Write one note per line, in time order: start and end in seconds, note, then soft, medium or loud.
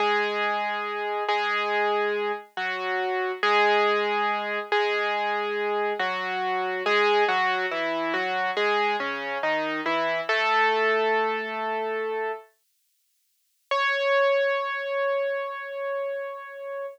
0.00 1.24 G#3 medium
0.00 1.24 G#4 loud
1.28 2.32 G#3 medium
1.28 2.32 G#4 loud
2.57 3.32 F#3 medium
2.57 3.32 F#4 medium
3.43 4.59 G#3 loud
3.43 4.59 G#4 loud
4.72 5.93 G#3 medium
4.72 5.93 G#4 loud
5.99 6.83 F#3 medium
5.99 6.83 F#4 medium
6.86 7.24 G#3 loud
6.86 7.24 G#4 loud
7.29 7.66 F#3 medium
7.29 7.66 F#4 loud
7.71 8.13 E3 medium
7.71 8.13 E4 medium
8.14 8.51 F#3 medium
8.14 8.51 F#4 medium
8.57 8.96 G#3 medium
8.57 8.96 G#4 loud
9.00 9.38 C#3 medium
9.00 9.38 C#4 medium
9.43 9.81 D#3 medium
9.43 9.81 D#4 medium
9.86 10.21 E3 medium
9.86 10.21 E4 medium
10.29 12.32 A3 loud
10.29 12.32 A4 loud
13.71 16.86 C#5 loud